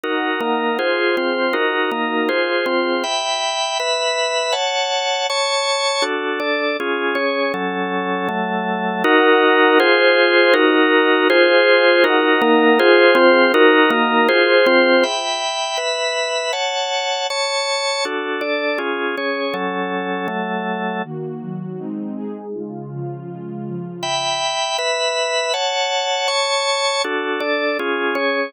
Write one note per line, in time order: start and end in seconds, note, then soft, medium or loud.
0.04 0.40 D#4 medium
0.04 0.78 D#4 medium
0.04 0.41 F#4 medium
0.04 0.40 A#4 medium
0.04 0.78 A#4 medium
0.04 0.78 F#5 medium
0.41 0.78 A#3 medium
0.41 0.78 D#4 medium
0.41 0.78 A#4 medium
0.79 1.53 F4 medium
0.79 1.16 F4 medium
0.79 1.53 G#4 medium
0.79 1.16 G#4 medium
0.79 1.53 C5 medium
0.79 1.16 C5 medium
1.17 1.54 C4 medium
1.17 1.54 F4 medium
1.17 1.54 C5 medium
1.53 1.90 D#4 medium
1.53 2.28 D#4 medium
1.53 1.90 F#4 medium
1.53 2.28 F#4 medium
1.53 1.90 A#4 medium
1.53 2.28 A#4 medium
1.91 2.29 A#3 medium
1.91 2.29 D#4 medium
1.91 2.29 A#4 medium
2.29 2.65 F4 medium
2.29 3.03 F4 medium
2.29 2.66 G#4 medium
2.29 3.03 G#4 medium
2.29 2.65 C5 medium
2.29 3.03 C5 medium
2.66 3.03 C4 medium
2.66 3.03 F4 medium
2.66 3.03 C5 medium
3.04 3.78 E5 medium
3.04 3.78 G5 medium
3.04 3.78 B5 medium
3.80 4.54 B4 medium
3.80 4.54 E5 medium
3.80 4.54 B5 medium
4.52 5.27 C#5 medium
4.52 5.27 F#5 medium
4.52 5.27 A5 medium
5.30 6.04 C#5 medium
5.30 6.04 A5 medium
5.30 6.04 C#6 medium
6.02 6.39 D4 medium
6.02 6.39 F#4 medium
6.02 6.39 A4 medium
6.40 6.77 D4 medium
6.40 6.77 A4 medium
6.40 6.77 D5 medium
6.80 7.15 C#4 medium
6.80 7.17 F4 medium
6.80 7.15 G#4 medium
7.15 7.52 C#4 medium
7.15 7.52 G#4 medium
7.15 7.52 C#5 medium
7.54 8.28 F#3 medium
7.54 8.28 C#4 medium
7.54 8.28 A4 medium
8.29 9.03 F#3 medium
8.29 9.03 A3 medium
8.29 9.03 A4 medium
9.04 9.78 D#4 loud
9.04 9.78 F#4 loud
9.04 9.78 A#4 loud
9.04 9.78 F#5 loud
9.79 10.53 F4 loud
9.79 10.54 F4 loud
9.79 10.53 G#4 loud
9.79 10.54 G#4 loud
9.79 10.53 C5 loud
9.79 10.54 C5 loud
10.54 11.28 D#4 loud
10.54 11.28 F#4 medium
10.54 11.28 F#4 loud
10.54 11.28 A#4 loud
11.29 12.03 F4 loud
11.29 12.04 F4 loud
11.29 12.03 G#4 loud
11.29 12.04 G#4 loud
11.29 12.03 C5 loud
11.29 12.04 C5 loud
12.04 12.78 D#4 loud
12.04 12.41 D#4 loud
12.04 12.41 F#4 medium
12.04 12.78 A#4 loud
12.04 12.41 A#4 loud
12.04 12.78 F#5 loud
12.42 12.79 A#3 loud
12.42 12.79 D#4 loud
12.42 12.79 A#4 loud
12.79 13.53 F4 loud
12.79 13.14 F4 loud
12.79 13.53 G#4 loud
12.79 13.17 G#4 loud
12.79 13.53 C5 loud
12.79 13.14 C5 loud
13.15 13.52 C4 loud
13.15 13.52 F4 loud
13.15 13.52 C5 loud
13.54 14.28 D#4 loud
13.54 13.90 D#4 loud
13.54 14.28 F#4 loud
13.54 13.91 F#4 loud
13.54 14.28 A#4 loud
13.54 13.90 A#4 loud
13.90 14.27 A#3 loud
13.90 14.27 D#4 loud
13.90 14.27 A#4 loud
14.29 14.66 F4 loud
14.29 15.03 F4 loud
14.29 14.66 G#4 loud
14.29 15.03 G#4 medium
14.29 14.66 C5 loud
14.29 15.03 C5 loud
14.66 15.04 C4 loud
14.66 15.04 F4 loud
14.66 15.04 C5 loud
15.03 15.77 E5 medium
15.03 15.78 G5 medium
15.03 15.77 B5 medium
15.77 16.52 B4 medium
15.77 16.52 E5 medium
15.77 16.52 B5 medium
16.53 17.27 C#5 medium
16.53 17.27 F#5 medium
16.53 17.27 A5 medium
17.30 18.04 C#5 medium
17.30 18.04 A5 medium
17.30 18.04 C#6 medium
18.05 18.41 D4 medium
18.05 18.42 F#4 medium
18.05 18.41 A4 medium
18.41 18.78 D4 medium
18.41 18.78 A4 medium
18.41 18.78 D5 medium
18.78 19.15 C#4 medium
18.78 19.15 F4 medium
18.78 19.15 G#4 medium
19.17 19.53 C#4 medium
19.17 19.55 G#4 medium
19.17 19.55 C#5 medium
19.54 20.27 F#3 medium
19.54 20.28 C#4 medium
19.54 20.27 A4 medium
20.28 21.02 F#3 medium
20.28 21.02 A3 medium
20.28 21.02 A4 medium
21.04 21.41 D#3 medium
21.04 21.41 A#3 medium
21.04 21.41 F#4 medium
21.41 21.78 D#3 medium
21.41 21.78 F#3 medium
21.41 21.78 F#4 medium
21.79 22.16 G#3 medium
21.79 22.16 C4 medium
21.79 22.16 D#4 medium
22.16 22.53 G#3 medium
22.16 22.53 D#4 medium
22.16 22.53 G#4 medium
22.54 22.91 C#3 medium
22.54 22.91 G#3 medium
22.54 22.91 F4 medium
22.91 23.28 C#3 medium
22.91 23.28 F3 medium
22.91 23.28 F4 medium
23.29 23.66 C#3 medium
23.29 23.66 G#3 medium
23.29 23.66 F4 medium
23.66 24.03 C#3 medium
23.66 24.03 F3 medium
23.66 24.03 F4 medium
24.03 24.77 E5 medium
24.03 24.77 G5 medium
24.03 24.77 B5 medium
24.78 25.53 B4 medium
24.78 25.53 E5 medium
24.78 25.53 B5 medium
25.54 26.27 C#5 medium
25.54 26.28 F#5 medium
25.54 26.27 A5 medium
26.28 27.02 C#5 medium
26.28 27.02 A5 medium
26.28 27.02 C#6 medium
27.04 27.40 D4 medium
27.04 27.41 F#4 medium
27.04 27.40 A4 medium
27.40 27.77 D4 medium
27.40 27.77 A4 medium
27.40 27.77 D5 medium
27.79 28.15 C#4 medium
27.79 28.16 F4 medium
27.79 28.15 G#4 medium
28.15 28.52 C#4 medium
28.15 28.52 G#4 medium
28.15 28.52 C#5 medium